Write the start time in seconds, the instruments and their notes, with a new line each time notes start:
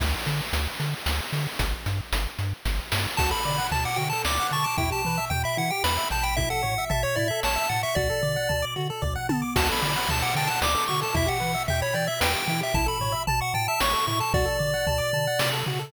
0.00 synth bass 1 D2, kick, crash
0.26 synth bass 1 D3, closed hi-hat
0.53 synth bass 1 D2, closed hi-hat
0.80 synth bass 1 D3, closed hi-hat
1.06 synth bass 1 D2, snare
1.33 synth bass 1 D3, open hi-hat
1.59 synth bass 1 G1, kick, closed hi-hat
1.86 synth bass 1 G2, closed hi-hat
2.12 synth bass 1 G1, closed hi-hat
2.39 synth bass 1 G2, closed hi-hat
2.65 synth bass 1 G1, kick, snare
2.92 synth bass 1 G2, snare
3.17 synth bass 1 D2, lead 1 (square) F#4 A5, kick, crash
3.31 lead 1 (square) A4 B5
3.45 synth bass 1 D3, lead 1 (square) D5, floor tom
3.58 lead 1 (square) F#5
3.71 synth bass 1 D2, lead 1 (square) A5, floor tom
3.85 lead 1 (square) F#5 D6
3.96 synth bass 1 D3, lead 1 (square) F#4 G5, floor tom
4.10 lead 1 (square) A4 A5
4.25 synth bass 1 D2, lead 1 (square) D5 D6, snare
4.40 lead 1 (square) F#5
4.51 synth bass 1 D3, lead 1 (square) A5 C#6, floor tom
4.64 lead 1 (square) A5 D6
4.78 synth bass 1 E2, lead 1 (square) E4 G5, kick, floor tom
4.90 lead 1 (square) G4 A5
5.05 synth bass 1 E3, lead 1 (square) B4, floor tom
5.18 lead 1 (square) E5
5.30 synth bass 1 E2, lead 1 (square) G5, floor tom
5.44 lead 1 (square) E5 B5
5.57 synth bass 1 E3, lead 1 (square) E4 F#5, floor tom
5.70 lead 1 (square) G4 G5
5.84 synth bass 1 E2, lead 1 (square) B4 B5, snare
5.97 lead 1 (square) E5
6.10 synth bass 1 A1, lead 1 (square) G5 A5, floor tom
6.22 lead 1 (square) G5 B5
6.37 lead 1 (square) E4 E5, kick, floor tom
6.50 lead 1 (square) A4 F#5
6.63 synth bass 1 A2, lead 1 (square) C#5, floor tom
6.78 lead 1 (square) E5
6.90 synth bass 1 A1, lead 1 (square) E5 A5, floor tom
7.03 lead 1 (square) C#5 C#6
7.16 synth bass 1 A2, lead 1 (square) E4 D5, floor tom
7.28 lead 1 (square) A4 E5
7.43 synth bass 1 A1, lead 1 (square) C#5 A5, snare
7.56 lead 1 (square) E5
7.69 synth bass 1 A2, lead 1 (square) F#5 A5, floor tom
7.83 lead 1 (square) E5 C#6
7.95 synth bass 1 D2, lead 1 (square) F#4 D5, kick, floor tom
8.10 lead 1 (square) A4
8.23 synth bass 1 D3, lead 1 (square) D5, floor tom
8.36 lead 1 (square) F#5
8.49 synth bass 1 D2, lead 1 (square) A5, floor tom
8.62 lead 1 (square) D6
8.76 synth bass 1 D3, lead 1 (square) F#4, floor tom
8.90 lead 1 (square) A4
9.02 synth bass 1 D2, lead 1 (square) D5, kick, floor tom
9.15 lead 1 (square) F#5
9.29 synth bass 1 D3, lead 1 (square) A5, high tom
9.42 lead 1 (square) D6
9.56 synth bass 1 D2, lead 1 (square) F#4 A5, kick, crash
9.68 lead 1 (square) A4 B5
9.82 synth bass 1 D3, lead 1 (square) D5, floor tom
9.96 lead 1 (square) F#5
10.09 synth bass 1 D2, lead 1 (square) A5, floor tom
10.22 lead 1 (square) F#5 D6
10.35 synth bass 1 D3, lead 1 (square) G5 A5, floor tom
10.47 lead 1 (square) F#5 A5
10.62 synth bass 1 D2, lead 1 (square) D5 D6, snare
10.75 lead 1 (square) A4
10.88 synth bass 1 D3, lead 1 (square) F#4 C#6, floor tom
11.01 lead 1 (square) A4 A5
11.14 synth bass 1 E2, lead 1 (square) E4 E5, kick, floor tom
11.26 lead 1 (square) G4 F#5
11.40 synth bass 1 E3, lead 1 (square) B4, floor tom
11.54 lead 1 (square) E5
11.68 synth bass 1 E2, lead 1 (square) E5 G5, floor tom
11.82 lead 1 (square) C#5 B5
11.94 synth bass 1 E3, lead 1 (square) D5 G5, floor tom
12.07 lead 1 (square) E5
12.20 synth bass 1 E2, lead 1 (square) B4 G5, snare
12.34 lead 1 (square) G4
12.48 synth bass 1 E3, lead 1 (square) E4 G5, floor tom
12.61 lead 1 (square) G4 E5
12.74 synth bass 1 A1, lead 1 (square) E4 A5, kick, floor tom
12.86 lead 1 (square) A4 B5
13.00 synth bass 1 A2, lead 1 (square) C#5, floor tom
13.12 lead 1 (square) E5
13.27 synth bass 1 A1, lead 1 (square) A5, floor tom
13.41 lead 1 (square) F#5 C#6
13.54 synth bass 1 A2, lead 1 (square) G5 A5, floor tom
13.68 lead 1 (square) E5 A5
13.80 synth bass 1 A1, lead 1 (square) C#5 C#6, snare
13.93 lead 1 (square) A4
14.07 synth bass 1 A2, lead 1 (square) E4 C#6, floor tom
14.20 lead 1 (square) A4 A5
14.33 synth bass 1 D2, lead 1 (square) F#4 D5, kick, floor tom
14.45 lead 1 (square) A4
14.59 synth bass 1 D3, lead 1 (square) D5, floor tom
14.74 lead 1 (square) F#5
14.87 synth bass 1 D2, lead 1 (square) A5, floor tom
14.98 lead 1 (square) D6
15.13 synth bass 1 D3, lead 1 (square) A5, floor tom
15.27 lead 1 (square) F#5
15.39 synth bass 1 C3, lead 1 (square) D5, snare
15.53 lead 1 (square) A4
15.66 synth bass 1 C#3, lead 1 (square) F#4, floor tom
15.79 lead 1 (square) A4